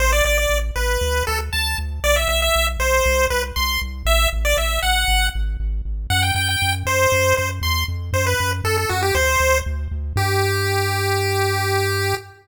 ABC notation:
X:1
M:4/4
L:1/16
Q:1/4=118
K:G
V:1 name="Lead 1 (square)"
c d d d2 z B4 A z a2 z2 | d e e e2 z c4 B z c'2 z2 | e2 z d e2 f4 z6 | f g g g2 z c4 c z c'2 z2 |
c B2 z A A F G c4 z4 | G16 |]
V:2 name="Synth Bass 1" clef=bass
A,,,2 A,,,2 A,,,2 A,,,2 D,,2 D,,2 D,,2 D,,2 | B,,,2 B,,,2 B,,,2 B,,,2 C,,2 C,,2 C,,2 C,,2 | A,,,2 A,,,2 A,,,2 A,,,2 _A,,,2 A,,,2 A,,,2 A,,,2 | F,,2 F,,2 F,,2 F,,2 F,,2 F,,2 E,,2 =F,,2 |
F,,2 F,,2 F,,2 F,,2 D,,2 D,,2 D,,2 D,,2 | G,,16 |]